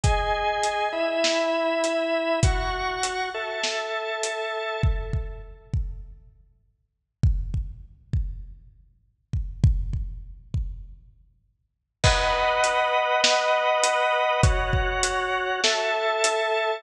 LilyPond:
<<
  \new Staff \with { instrumentName = "Drawbar Organ" } { \time 4/4 \key b \mixolydian \tempo 4 = 100 <gis' dis'' gis''>4. <e' e'' b''>2~ <e' e'' b''>8 | <fis' fis'' cis'''>4. <a' e'' a''>2~ <a' e'' a''>8 | \key c \mixolydian r1 | r1 |
r1 | \key b \mixolydian <b' dis'' fis''>2 <b' dis'' fis''>2 | <fis' cis'' fis''>2 <a' e'' a''>2 | }
  \new DrumStaff \with { instrumentName = "Drums" } \drummode { \time 4/4 <hh bd>4 hh4 sn4 hh4 | <hh bd>4 hh4 sn4 hh4 | bd8 bd8 r8 bd8 r4 r4 | bd8 bd8 r8 bd8 r4 r8 bd8 |
bd8 bd8 r8 bd8 r4 r4 | <cymc bd>4 hh4 sn4 hh4 | <hh bd>8 bd8 hh4 sn4 hh4 | }
>>